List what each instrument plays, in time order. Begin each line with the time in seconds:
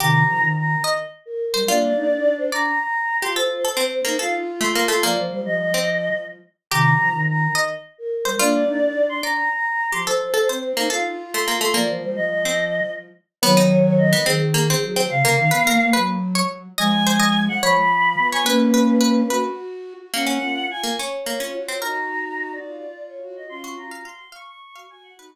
0.00 flute C3 D#3, harpsichord G4, choir aahs A#5
0.28 flute F3
0.42 flute D#3
0.57 choir aahs A#5
0.84 choir aahs D#5, harpsichord D#5
1.26 choir aahs A#4
1.54 flute G3, choir aahs A#4, harpsichord C5
1.68 flute A#3 D4, harpsichord F4, choir aahs D5
1.96 flute D#4
2.10 flute D4
2.38 choir aahs C5
2.52 harpsichord D5, choir aahs A#5
2.79 choir aahs A#5
3.22 flute F4, harpsichord G4, choir aahs C6
3.35 harpsichord A4, choir aahs C5
3.65 harpsichord A4
3.77 harpsichord C4, flute C4
3.91 choir aahs C5
4.05 harpsichord A#3, flute D#4
4.19 flute F4, harpsichord A4, choir aahs F5
4.61 harpsichord A3, choir aahs C6
4.75 harpsichord A#3
4.88 harpsichord A3, choir aahs C6
5.03 flute F3, harpsichord A#3, choir aahs D5
5.17 flute F3, choir aahs C5
5.31 flute G3, choir aahs C5
5.46 flute F3, choir aahs D#5
5.74 harpsichord C4
6.71 flute C3 D#3, harpsichord G4, choir aahs A#5
6.99 flute F3
7.13 flute D#3
7.28 choir aahs A#5
7.55 harpsichord D#5, choir aahs D#5
7.98 choir aahs A#4
8.25 flute G3, choir aahs A#4, harpsichord C5
8.39 flute A#3 D4, harpsichord F4, choir aahs D5
8.67 flute D#4
8.81 flute D4
9.09 choir aahs C6
9.23 harpsichord D5, choir aahs A#5
9.52 choir aahs A#5
9.92 flute F3, harpsichord G4, choir aahs C6
10.06 harpsichord A4, choir aahs C5
10.34 harpsichord A4
10.49 flute C4, harpsichord C5
10.63 choir aahs C5
10.77 harpsichord A#3, flute D#4
10.90 flute F4, harpsichord A4, choir aahs F5
11.33 harpsichord A3, choir aahs C6
11.48 harpsichord A#3
11.61 harpsichord A3, choir aahs C6
11.74 flute F3, harpsichord A#3, choir aahs D5
11.88 flute F3, choir aahs C5
12.03 flute G3, choir aahs C5
12.16 flute F3, choir aahs D#5
12.45 harpsichord C4
13.42 flute D#3 F#3, harpsichord B3, choir aahs C#5
13.57 harpsichord D#4
13.98 choir aahs D#5
14.13 harpsichord B3
14.26 flute D#3, harpsichord C4, choir aahs G#4
14.54 harpsichord A#3
14.70 harpsichord C4
14.83 flute F#3
14.96 harpsichord C4
15.10 flute C#3, choir aahs F5
15.24 flute C#3, harpsichord A#3
15.38 flute D#3
15.51 flute B3, harpsichord B4
15.67 flute A#3, harpsichord A#4
15.80 flute A#3
15.93 flute F#3, harpsichord B4
16.35 harpsichord C#5
16.78 flute F3 G#3, harpsichord D#5, choir aahs G#5
17.07 harpsichord C5
17.20 harpsichord D#5
17.48 choir aahs F#5
17.62 flute F3, harpsichord C#5, choir aahs B5
18.18 flute B3
18.32 harpsichord C#5, choir aahs G#5
18.46 flute A#3 C#4, harpsichord B4, choir aahs B4
18.74 harpsichord B4
19.01 harpsichord B4
19.30 flute F#4, harpsichord B4
20.14 harpsichord A#3, flute A#3 C#4, choir aahs F#5
20.27 harpsichord C#4
20.42 flute F4
20.71 choir aahs G#5
20.84 harpsichord A#3
20.98 harpsichord C#4, choir aahs C#5
21.26 harpsichord A#3
21.40 harpsichord C#4, flute F4
21.54 flute F#4
21.68 harpsichord C4
21.81 flute D#4 F#4, harpsichord A#4, choir aahs A#5
22.52 choir aahs D5
22.66 flute F4
23.07 choir aahs C#5
23.22 flute F#4
23.37 choir aahs D#5
23.49 flute C#4 F4, choir aahs C6
23.64 harpsichord F#4
23.77 flute F#4, choir aahs A#5
23.91 harpsichord F5
24.05 harpsichord F5, choir aahs C6
24.32 harpsichord F5, choir aahs C#6
24.47 choir aahs C#6
24.76 flute F#4, harpsichord F5
24.90 flute F#4, choir aahs G#5
25.03 choir aahs F#5
25.17 flute D#4 F#4, choir aahs F#4, harpsichord B4